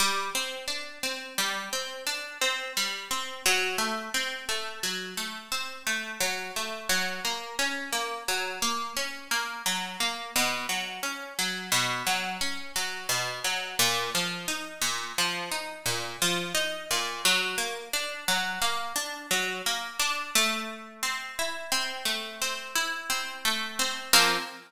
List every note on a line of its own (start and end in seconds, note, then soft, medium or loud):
0.00 0.30 G3 medium
0.35 0.66 C4 medium
0.68 0.99 D4 medium
1.03 1.34 C4 medium
1.38 1.69 G3 medium
1.73 2.04 C4 medium
2.07 2.38 D4 medium
2.41 2.72 C4 medium
2.77 3.08 G3 medium
3.11 3.42 C4 medium
3.46 3.77 F#3 loud
3.78 4.09 A3 medium
4.14 4.45 C4 medium
4.49 4.80 A3 medium
4.83 5.14 F#3 medium
5.17 5.48 A3 medium
5.52 5.83 C4 medium
5.87 6.18 A3 medium
6.21 6.52 F#3 medium
6.56 6.87 A3 medium
6.89 7.20 F#3 medium
7.25 7.56 A#3 medium
7.59 7.90 C#4 medium
7.93 8.24 A#3 medium
8.28 8.59 F#3 medium
8.62 8.93 A#3 medium
8.97 9.28 C#4 medium
9.31 9.62 A#3 medium
9.66 9.97 F#3 medium
10.00 10.31 A#3 medium
10.36 10.67 B2 medium
10.69 11.00 F#3 medium
11.03 11.34 C#4 medium
11.39 11.70 F#3 medium
11.72 12.03 B2 medium
12.07 12.38 F#3 medium
12.41 12.72 C#4 medium
12.76 13.07 F#3 medium
13.09 13.40 B2 medium
13.44 13.75 F#3 medium
13.79 14.10 A#2 loud
14.15 14.46 F3 medium
14.48 14.79 D#4 medium
14.81 15.12 A#2 medium
15.18 15.49 F3 medium
15.52 15.83 D#4 medium
15.86 16.17 A#2 medium
16.22 16.53 F3 medium
16.55 16.86 D#4 medium
16.91 17.22 A#2 medium
17.25 17.56 F#3 loud
17.58 17.89 A#3 medium
17.93 18.24 D4 medium
18.28 18.59 F#3 medium
18.62 18.93 A#3 medium
18.96 19.27 D4 medium
19.31 19.62 F#3 medium
19.66 19.97 A#3 medium
19.99 20.30 D4 medium
20.35 22.05 A3 loud
21.03 21.71 C4 medium
21.39 22.75 E4 medium
21.72 22.41 C4 medium
22.05 23.45 A3 medium
22.42 23.09 C4 medium
22.75 24.06 E4 medium
23.10 23.79 C4 medium
23.45 24.10 A3 medium
23.79 24.12 C4 medium
24.13 24.37 F3 medium
24.13 24.37 A#3 loud
24.13 24.37 C4 loud